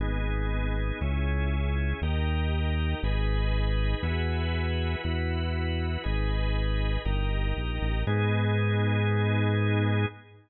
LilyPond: <<
  \new Staff \with { instrumentName = "Synth Bass 1" } { \clef bass \time 4/4 \key gis \minor \tempo 4 = 119 gis,,2 cis,2 | dis,2 gis,,2 | e,2 e,2 | gis,,2 g,,4 ais,,8 a,,8 |
gis,1 | }
  \new Staff \with { instrumentName = "Drawbar Organ" } { \time 4/4 \key gis \minor <b dis' gis'>2 <cis' e' gis'>2 | <dis' g' ais'>2 <dis' gis' b'>2 | <e' fis' gis' b'>2 <e' fis' b'>2 | <dis' gis' b'>2 <dis' g' ais'>2 |
<b dis' gis'>1 | }
>>